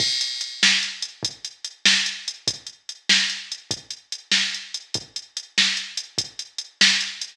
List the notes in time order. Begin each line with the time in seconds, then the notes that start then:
0.00 kick, crash
0.21 closed hi-hat
0.41 closed hi-hat
0.63 snare
0.83 closed hi-hat
1.02 closed hi-hat
1.23 kick, closed hi-hat
1.45 closed hi-hat
1.65 closed hi-hat
1.85 snare
2.06 closed hi-hat
2.28 closed hi-hat
2.48 kick, closed hi-hat
2.67 closed hi-hat
2.89 closed hi-hat
3.09 snare
3.30 closed hi-hat
3.52 closed hi-hat
3.71 kick, closed hi-hat
3.91 closed hi-hat
4.12 closed hi-hat
4.32 snare
4.54 closed hi-hat
4.74 closed hi-hat
4.94 kick, closed hi-hat
5.16 closed hi-hat
5.37 closed hi-hat
5.58 snare
5.77 closed hi-hat
5.97 closed hi-hat
6.18 kick, closed hi-hat
6.39 closed hi-hat
6.58 closed hi-hat
6.81 snare
7.01 closed hi-hat
7.21 closed hi-hat